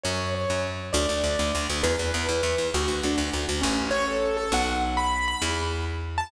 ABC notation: X:1
M:6/8
L:1/8
Q:3/8=134
K:A
V:1 name="Acoustic Grand Piano"
c2 c2 z2 | [K:D] d6 | B6 | F2 D z3 |
[K:A] C2 c A2 A | f z2 b2 b | z5 a |]
V:2 name="Electric Bass (finger)" clef=bass
F,,3 F,,3 | [K:D] D,, D,, D,, D,, D,, D,, | E,, E,, E,, E,, E,, E,, | D,, D,, D,, D,, D,, D,, |
[K:A] A,,,6 | B,,,6 | E,,6 |]